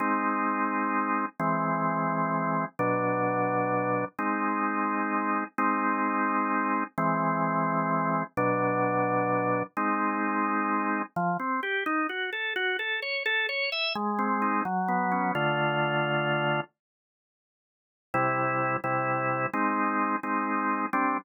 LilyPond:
\new Staff { \time 6/8 \key c \lydian \tempo 4. = 86 <aes c' ees'>2. | <e gis bis>2. | <b, fis d'>2. | <aes c' ees'>2. |
<aes c' ees'>2. | <e gis bis>2. | <b, fis d'>2. | <aes c' ees'>2. |
\key des \lydian f8 c'8 g'8 ees'8 ges'8 a'8 | ges'8 a'8 des''8 a'8 cis''8 e''8 | aes8 c'8 ees'8 ges8 ces'8 des'8 | \key c \lydian <d a f'>2. |
r2. | <c g e'>4. <c g e'>4. | <aes c' ees'>4. <aes c' ees'>4. | <g c' d'>4. r4. | }